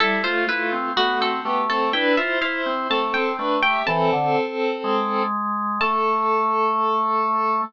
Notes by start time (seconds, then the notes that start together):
0.00 G3 E4 A4
0.23 A3 F4 C5
0.47 A3 E4 F4 B4
0.72 C4
0.96 A3 B3 F#4
1.21 C4 A4
1.45 A3 B3 G4
1.69 C4 A4
1.93 D4 E4 B4 G5
2.17 E4 F4 C5 E5
2.41 E4 C5 F5
2.66 C4
2.90 A3 C4 A4 A5
3.14 C4 G5
3.38 A3 D4 B4
3.63 G4 E5 G5
3.86 E3 C4 A4 A5
4.12 D3
4.84 G#3
5.81 A3 A4 A5